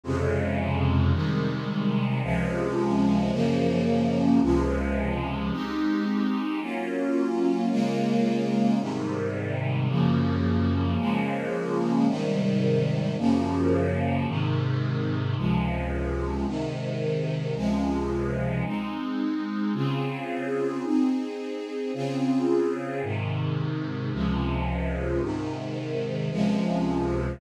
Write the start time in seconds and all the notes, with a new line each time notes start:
0.04 F2 C3 C#3 G#3
1.13 C3 D#3 G3 G#3
2.23 C#2 C3 F3 G#3
3.31 F#2 C#3 F3 A#3
4.42 C#2 C3 F3 G#3
5.51 G#3 C4 D#4 G4
6.60 F#3 A#3 C#4 F4
7.70 C#3 G#3 A#3 F4
8.80 G#2 C3 D#3 G3
9.89 F#2 C#3 F3 A#3
10.98 C#3 F3 G#3 A#3
12.07 G#2 C3 D#3 G3
13.18 F#2 C#3 F3 A#3
14.27 G#2 C3 D#3
15.37 C#2 C3 F3 G#3
16.46 G#2 C3 D#3
17.55 C#2 C3 F3 G#3
18.65 G#3 C4 D#4
19.74 C#3 C4 F4 G#4
20.84 C4 D#4 G#4
21.94 C#3 C4 F4 G#4
23.03 G#2 C3 D#3
24.12 C#2 C3 F3 G#3
25.21 G#2 C3 D#3
26.31 C#2 C3 F3 G#3